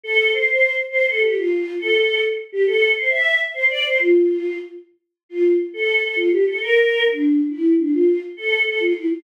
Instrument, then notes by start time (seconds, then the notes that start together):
choir aahs
0.04 A4
0.33 C5
0.48 C5
0.90 C5
1.06 A4
1.21 G4
1.34 F4
1.79 A4
2.52 G4
2.67 A4
2.95 C5
3.10 E5
3.54 C5
3.69 D5
3.84 C5
3.98 F4
5.29 F4
5.74 A4
6.03 A4
6.16 F4
6.32 G4
6.47 A4
6.61 A#4
7.05 D4
7.48 E4
7.78 D4
7.92 F4
8.37 A4
8.66 A4
8.80 F4
8.95 E4
9.08 F4